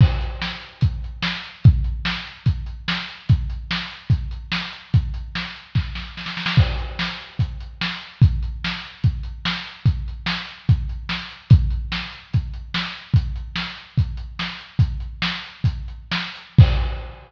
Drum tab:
CC |x---------------|----------------|----------------|----------------|
HH |--x---x-x-x---x-|x-x---x-x-x---x-|x-x---x-x-x---x-|x-x---x---------|
SD |----o-------o---|----o-------o---|----o-------o---|----o---o-o-oooo|
BD |o-------o-------|o-------o-------|o-------o-------|o-------o-------|

CC |x---------------|----------------|----------------|----------------|
HH |--x---x-x-x---x-|x-x---x-x-x---x-|x-x---x-x-x---x-|x-x---x-x-x---x-|
SD |----o-------o---|----o-------o---|----o-------o---|----o-------o---|
BD |o-------o-------|o-------o-------|o-------o-------|o-------o-------|

CC |----------------|----------------|x---------------|
HH |x-x---x-x-x---x-|x-x---x-x-x---x-|----------------|
SD |----o-------o---|----o-------o---|----------------|
BD |o-------o-------|o-------o-------|o---------------|